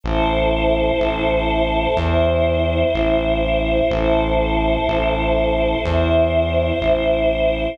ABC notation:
X:1
M:4/4
L:1/8
Q:1/4=62
K:Em
V:1 name="Choir Aahs"
[EAc]4 [Ece]4 | [EAc]4 [Ece]4 |]
V:2 name="Synth Bass 1" clef=bass
A,,,2 A,,,2 E,,2 A,,,2 | A,,,2 A,,,2 E,,2 A,,,2 |]